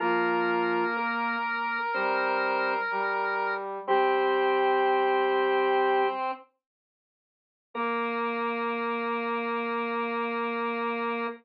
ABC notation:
X:1
M:4/4
L:1/8
Q:1/4=62
K:Bb
V:1 name="Drawbar Organ"
[F,F]2 [B,B]2 [Cc]2 z2 | [G,G]5 z3 | B8 |]
V:2 name="Lead 1 (square)"
B8 | C6 z2 | B,8 |]
V:3 name="Brass Section"
B,3 z G,2 G,2 | C5 z3 | B,8 |]